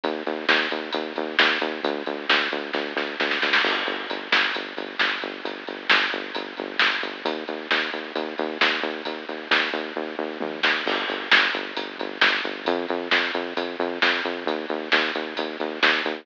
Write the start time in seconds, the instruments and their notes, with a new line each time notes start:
0.03 synth bass 1 D#2, kick, closed hi-hat
0.26 synth bass 1 D#2, closed hi-hat
0.49 synth bass 1 D#2, snare
0.71 synth bass 1 D#2, closed hi-hat
0.92 synth bass 1 D#2, kick, closed hi-hat
1.16 synth bass 1 D#2, kick, closed hi-hat
1.39 synth bass 1 D#2, snare
1.61 synth bass 1 D#2, kick, closed hi-hat
1.83 synth bass 1 D2, kick, closed hi-hat
2.06 synth bass 1 D2, closed hi-hat
2.29 synth bass 1 D2, snare
2.52 synth bass 1 D2, closed hi-hat
2.73 synth bass 1 D2, kick, snare
2.96 synth bass 1 D2, snare
3.19 synth bass 1 D2, snare
3.31 snare
3.42 synth bass 1 D2, snare
3.53 snare
3.64 synth bass 1 G1, kick, crash
3.87 synth bass 1 G1, closed hi-hat
4.09 synth bass 1 G1, closed hi-hat
4.32 synth bass 1 G1, snare
4.55 synth bass 1 G1, kick, closed hi-hat
4.77 synth bass 1 G1, kick, closed hi-hat
4.99 synth bass 1 G1, snare
5.22 synth bass 1 G1, kick, closed hi-hat
5.45 synth bass 1 G1, kick, closed hi-hat
5.67 synth bass 1 G1, closed hi-hat
5.89 synth bass 1 G1, snare
6.11 synth bass 1 G1, closed hi-hat
6.35 synth bass 1 G1, kick, closed hi-hat
6.57 synth bass 1 G1, kick, closed hi-hat
6.79 synth bass 1 G1, snare
7.03 synth bass 1 G1, kick, closed hi-hat
7.25 synth bass 1 D#2, kick, closed hi-hat
7.48 synth bass 1 D#2, closed hi-hat
7.70 synth bass 1 D#2, snare
7.93 synth bass 1 D#2, closed hi-hat
8.15 synth bass 1 D#2, kick, closed hi-hat
8.38 synth bass 1 D#2, kick, closed hi-hat
8.61 synth bass 1 D#2, snare
8.83 synth bass 1 D#2, kick, closed hi-hat
9.05 synth bass 1 D#2, kick, closed hi-hat
9.28 synth bass 1 D#2, closed hi-hat
9.51 synth bass 1 D#2, snare
9.73 synth bass 1 D#2, closed hi-hat
9.96 synth bass 1 D#2, kick, floor tom
10.19 synth bass 1 D#2
10.40 synth bass 1 D#2, high tom
10.63 synth bass 1 D#2, snare
10.86 synth bass 1 G1, kick, crash
11.08 synth bass 1 G1, closed hi-hat
11.31 synth bass 1 G1, snare
11.54 synth bass 1 G1, closed hi-hat
11.77 synth bass 1 G1, kick, closed hi-hat
11.98 synth bass 1 G1, kick, closed hi-hat
12.21 synth bass 1 G1, snare
12.44 synth bass 1 G1, kick, closed hi-hat
12.65 synth bass 1 F2, kick, closed hi-hat
12.88 synth bass 1 F2, closed hi-hat
13.11 synth bass 1 F2, snare
13.34 synth bass 1 F2, closed hi-hat
13.57 synth bass 1 F2, kick, closed hi-hat
13.79 synth bass 1 F2, kick, closed hi-hat
14.02 synth bass 1 F2, snare
14.25 synth bass 1 F2, kick, closed hi-hat
14.46 synth bass 1 D#2, kick, closed hi-hat
14.69 synth bass 1 D#2, closed hi-hat
14.92 synth bass 1 D#2, snare
15.15 synth bass 1 D#2, closed hi-hat
15.36 synth bass 1 D#2, kick, closed hi-hat
15.60 synth bass 1 D#2, kick, closed hi-hat
15.83 synth bass 1 D#2, snare
16.05 synth bass 1 D#2, kick, closed hi-hat